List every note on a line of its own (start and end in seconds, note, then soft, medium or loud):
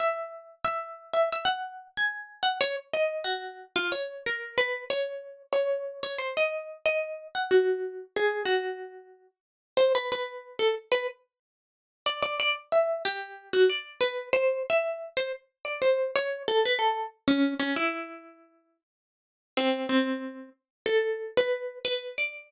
0.00 0.55 E5 medium
0.65 1.12 E5 medium
1.13 1.29 E5 medium
1.32 1.48 E5 medium
1.45 1.88 F#5 medium
1.97 2.42 G#5 medium
2.43 2.58 F#5 medium
2.61 2.76 C#5 medium
2.93 3.24 D#5 medium
3.24 3.65 F#4 medium
3.76 3.91 F4 medium
3.92 4.23 C#5 medium
4.26 4.58 A#4 medium
4.58 4.85 B4 medium
4.90 5.43 C#5 medium
5.53 6.00 C#5 medium
6.03 6.19 C#5 medium
6.18 6.34 C5 medium
6.37 6.77 D#5 medium
6.86 7.27 D#5 medium
7.35 7.50 F#5 medium
7.51 8.04 F#4 medium
8.16 8.43 G#4 medium
8.45 9.27 F#4 medium
9.77 9.93 C5 loud
9.95 10.10 B4 medium
10.12 10.57 B4 medium
10.59 10.75 A4 medium
10.92 11.07 B4 medium
12.06 12.22 D5 medium
12.22 12.38 D5 medium
12.40 12.55 D5 loud
12.72 13.02 E5 medium
13.05 13.49 G4 medium
13.53 13.69 F#4 medium
13.70 13.99 D5 medium
14.01 14.29 B4 medium
14.33 14.63 C5 medium
14.70 15.09 E5 medium
15.17 15.32 C5 medium
15.65 15.80 D5 medium
15.82 16.11 C5 medium
16.16 16.43 C#5 medium
16.48 16.63 A4 medium
16.65 16.81 B4 medium
16.79 17.07 A4 medium
17.28 17.54 C#4 loud
17.60 17.75 C#4 medium
17.76 18.77 E4 medium
19.57 19.87 C4 loud
19.89 20.49 C4 medium
20.86 21.31 A4 medium
21.37 21.79 B4 medium
21.85 22.16 B4 medium
22.18 22.51 D5 loud